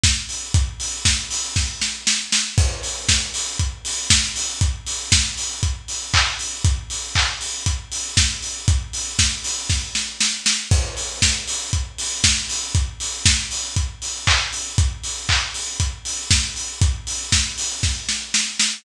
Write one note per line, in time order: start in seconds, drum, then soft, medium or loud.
0.03 kick loud
0.03 snare loud
0.29 open hi-hat medium
0.54 kick loud
0.54 closed hi-hat loud
0.80 open hi-hat medium
1.05 kick medium
1.05 snare loud
1.31 open hi-hat medium
1.56 kick loud
1.56 snare medium
1.81 snare medium
2.07 snare loud
2.32 snare loud
2.58 kick loud
2.58 crash loud
2.83 open hi-hat medium
3.09 kick medium
3.09 snare loud
3.34 open hi-hat loud
3.59 kick loud
3.59 closed hi-hat loud
3.85 open hi-hat loud
4.10 kick loud
4.10 snare loud
4.36 open hi-hat medium
4.61 kick loud
4.61 closed hi-hat loud
4.87 open hi-hat medium
5.12 kick loud
5.12 snare loud
5.37 open hi-hat medium
5.63 kick loud
5.63 closed hi-hat loud
5.88 open hi-hat medium
6.14 kick loud
6.14 clap loud
6.39 open hi-hat medium
6.65 kick loud
6.65 closed hi-hat loud
6.90 open hi-hat medium
7.15 kick medium
7.15 clap loud
7.41 open hi-hat medium
7.66 kick loud
7.66 closed hi-hat loud
7.92 open hi-hat medium
8.17 kick loud
8.17 snare loud
8.42 open hi-hat medium
8.68 kick loud
8.68 closed hi-hat loud
8.93 open hi-hat medium
9.19 kick medium
9.19 snare loud
9.44 open hi-hat medium
9.70 kick loud
9.70 snare medium
9.95 snare medium
10.20 snare loud
10.46 snare loud
10.71 kick loud
10.71 crash loud
10.97 open hi-hat medium
11.22 kick medium
11.22 snare loud
11.48 open hi-hat loud
11.73 kick loud
11.73 closed hi-hat loud
11.98 open hi-hat loud
12.24 kick loud
12.24 snare loud
12.49 open hi-hat medium
12.75 kick loud
12.75 closed hi-hat loud
13.00 open hi-hat medium
13.26 kick loud
13.26 snare loud
13.51 open hi-hat medium
13.76 kick loud
13.76 closed hi-hat loud
14.02 open hi-hat medium
14.27 kick loud
14.27 clap loud
14.53 open hi-hat medium
14.78 kick loud
14.78 closed hi-hat loud
15.03 open hi-hat medium
15.29 kick medium
15.29 clap loud
15.54 open hi-hat medium
15.80 kick loud
15.80 closed hi-hat loud
16.05 open hi-hat medium
16.31 kick loud
16.31 snare loud
16.56 open hi-hat medium
16.81 kick loud
16.81 closed hi-hat loud
17.07 open hi-hat medium
17.32 kick medium
17.32 snare loud
17.58 open hi-hat medium
17.83 kick loud
17.83 snare medium
18.09 snare medium
18.34 snare loud
18.59 snare loud